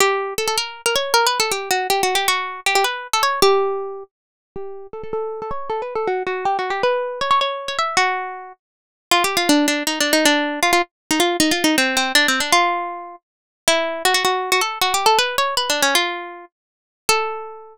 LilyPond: \new Staff { \time 3/4 \key a \mixolydian \tempo 4 = 158 g'4 a'16 a'16 bes'8. bes'16 cis''8 | \tuplet 3/2 { ais'8 b'8 a'8 } g'8 fis'8 \tuplet 3/2 { g'8 fis'8 g'8 } | fis'4 g'16 g'16 b'8. a'16 cis''8 | g'2 r4 |
g'4 a'16 a'16 a'8. a'16 cis''8 | \tuplet 3/2 { a'8 b'8 a'8 } fis'8 fis'8 \tuplet 3/2 { g'8 fis'8 g'8 } | b'4 cis''16 cis''16 cis''8. cis''16 e''8 | fis'4. r4. |
\key bes \mixolydian \tuplet 3/2 { f'8 g'8 f'8 } d'8 d'8 \tuplet 3/2 { ees'8 d'8 ees'8 } | d'4 f'16 f'16 r8. ees'16 f'8 | \tuplet 3/2 { ees'8 f'8 ees'8 } c'8 c'8 \tuplet 3/2 { d'8 c'8 d'8 } | f'2 r4 |
\key a \mixolydian e'4 fis'16 fis'16 fis'8. fis'16 a'8 | \tuplet 3/2 { fis'8 g'8 a'8 } b'8 cis''8 \tuplet 3/2 { b'8 d'8 cis'8 } | f'4. r4. | a'2. | }